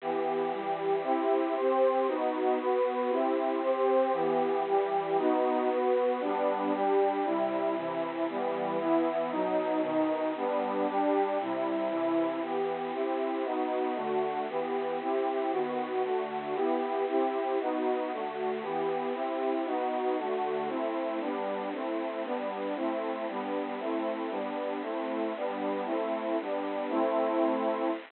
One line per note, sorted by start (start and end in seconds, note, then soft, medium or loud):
0.01 0.51 E3 medium
0.01 0.52 B3 medium
0.01 0.51 G4 medium
0.52 1.03 E3 medium
0.52 1.03 G3 medium
0.52 1.02 G4 medium
1.03 1.54 C4 medium
1.03 1.54 E4 medium
1.03 1.54 G4 medium
1.56 2.07 C4 medium
1.56 2.07 G4 medium
1.56 2.07 C5 medium
2.07 2.58 B3 medium
2.07 2.58 D#4 medium
2.07 2.58 F#4 medium
2.60 3.11 B3 medium
2.60 3.11 F#4 medium
2.60 3.11 B4 medium
3.10 3.61 C4 medium
3.10 3.61 E4 medium
3.10 3.61 G4 medium
3.63 4.14 C4 medium
3.63 4.12 G4 medium
3.63 4.14 C5 medium
4.12 4.64 E3 loud
4.12 4.64 B3 medium
4.12 4.64 G4 medium
4.65 5.17 E3 medium
4.65 5.17 G3 medium
4.65 5.17 G4 medium
5.18 5.69 B3 loud
5.18 5.69 D#4 loud
5.18 5.69 F#4 medium
5.70 6.20 B3 medium
5.70 6.21 F#4 medium
5.70 6.21 B4 medium
6.20 6.72 G3 medium
6.20 6.72 B3 medium
6.20 6.72 D4 loud
6.74 7.24 G3 medium
6.74 7.25 D4 medium
6.74 7.25 G4 loud
7.25 7.75 C3 medium
7.25 7.76 G3 medium
7.25 7.75 E4 medium
7.75 8.26 C3 medium
7.75 8.26 E3 medium
7.75 8.26 E4 medium
8.28 8.78 E3 loud
8.28 8.80 G3 medium
8.28 8.78 B3 medium
8.78 9.29 E3 medium
8.78 9.29 B3 medium
8.78 9.29 E4 loud
9.31 9.81 B2 loud
9.31 9.82 F#3 medium
9.31 9.81 D#4 loud
9.81 10.32 B2 medium
9.81 10.32 D#3 medium
9.81 10.32 D#4 loud
10.36 10.86 G3 medium
10.36 10.87 B3 loud
10.36 10.86 D4 medium
10.87 11.38 G3 medium
10.87 11.38 D4 loud
10.87 11.38 G4 medium
11.40 11.88 C3 loud
11.40 11.91 G3 medium
11.40 11.88 E4 medium
11.89 12.40 C3 medium
11.89 12.40 E3 medium
11.89 12.40 E4 loud
12.41 12.92 E3 medium
12.41 12.92 B3 medium
12.41 12.92 G4 medium
12.93 13.44 C4 medium
12.93 13.44 E4 medium
12.93 13.44 G4 medium
13.44 13.96 B3 medium
13.44 13.96 D#4 medium
13.44 13.94 F#4 medium
13.95 14.46 D3 medium
13.95 14.46 A3 medium
13.95 14.46 F#4 medium
14.48 14.99 E3 medium
14.48 14.99 B3 medium
14.48 14.99 G4 medium
15.00 15.51 C4 medium
15.00 15.51 E4 medium
15.00 15.51 G4 medium
15.51 16.02 D#3 medium
15.51 16.02 B3 medium
15.51 16.02 F#4 medium
16.03 16.54 D3 medium
16.03 16.54 A3 medium
16.03 16.54 F#4 medium
16.54 17.05 B3 medium
16.54 17.05 E4 medium
16.54 17.05 G4 medium
17.07 17.58 C4 medium
17.07 17.58 E4 medium
17.07 17.58 G4 medium
17.60 18.11 B3 medium
17.60 18.11 D#4 medium
17.60 18.11 F#4 medium
18.11 18.63 D3 medium
18.11 18.63 A3 medium
18.11 18.63 F#4 medium
18.62 19.13 E3 medium
18.62 19.13 B3 medium
18.62 19.13 G4 medium
19.14 19.65 C4 medium
19.14 19.65 E4 medium
19.14 19.65 G4 medium
19.65 20.17 B3 medium
19.65 20.17 D#4 medium
19.65 20.17 F#4 medium
20.17 20.68 D3 medium
20.17 20.68 A3 medium
20.17 20.68 F#4 medium
20.68 21.19 A3 medium
20.68 21.19 C4 medium
20.68 21.19 E4 medium
21.20 21.72 G3 medium
21.20 21.72 B3 medium
21.20 21.72 D4 medium
21.72 22.23 A3 medium
21.72 22.23 C4 medium
21.72 22.23 E4 medium
22.23 22.75 G3 medium
22.23 22.75 B3 medium
22.23 22.75 D4 medium
22.75 23.26 A3 medium
22.75 23.26 C4 medium
22.75 23.26 E4 medium
23.28 23.79 G3 medium
23.28 23.79 B3 medium
23.28 23.79 D4 medium
23.79 24.30 A3 medium
23.79 24.30 C4 medium
23.79 24.30 E4 medium
24.30 24.81 G3 medium
24.30 24.81 B3 medium
24.30 24.81 D4 medium
24.82 25.33 A3 medium
24.82 25.33 C4 medium
24.82 25.33 E4 medium
25.36 25.87 G3 medium
25.36 25.87 B3 medium
25.36 25.87 D4 medium
25.85 26.37 A3 medium
25.85 26.37 C4 medium
25.85 26.37 E4 medium
26.40 26.91 G3 medium
26.40 26.91 B3 medium
26.40 26.91 D4 medium
26.90 27.90 A3 medium
26.90 27.90 C4 loud
26.90 27.90 E4 loud